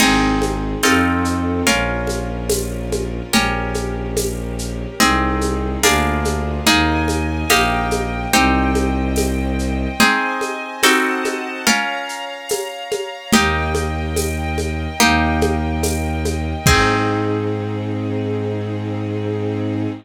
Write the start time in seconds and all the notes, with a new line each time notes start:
0.00 G#1 C4 D#4 G#4, crash, low conga, shaker
0.42 high conga, shaker
0.83 F2 C4 D#4 F4 A4, tambourine, high conga, shaker
1.25 shaker
1.67 A#1 C#4 F4 A#4, low conga, shaker
2.07 high conga, shaker
2.49 tambourine, high conga, shaker
2.92 high conga, shaker
3.32 A#1 C#4 G4 A#4, low conga, shaker
3.74 high conga, shaker
4.17 tambourine, high conga, shaker
4.59 shaker
5.00 C2 C4 D#4 G#4, low conga, shaker
5.41 high conga, shaker
5.83 D2 A#3 D4 F4 G#4, tambourine, high conga, shaker
6.25 high conga, shaker
6.66 D#2 A#3 D#4 G#4 A#4 D#5 G#5, low conga, shaker
7.08 high conga, shaker
7.50 A#1 A#3 D#4 G4 A#4 D#5 G5, tambourine, high conga, shaker
7.91 high conga, shaker
8.33 C2 C4 D#4 G4 C5 D#5 G5, low conga, shaker
8.75 high conga, shaker
9.16 tambourine, high conga, shaker
9.59 shaker
9.99 C4 D#4 G#4 C5 D#5 G#5, low conga, shaker
10.41 high conga, shaker
10.83 C4 D#4 F#4 A4 C5 D#5 F#5 A5, tambourine, high conga, shaker
11.25 high conga, shaker
11.66 C#4 F4 A#4 C#5 F5 A#5, low conga, shaker
12.09 shaker
12.49 tambourine, high conga, shaker
12.91 high conga, shaker
13.32 D#2 A#3 D#4 G4 A#4 D#5 G5, low conga, shaker
13.75 high conga, shaker
14.16 tambourine, high conga, shaker
14.58 high conga, shaker
15.00 D#2 A#3 D#4 G4 A#4 D#5 G5, low conga, shaker
15.41 high conga, shaker
15.83 tambourine, high conga, shaker
16.25 high conga, shaker
16.65 G#2 C4 D#4 G#4, kick, crash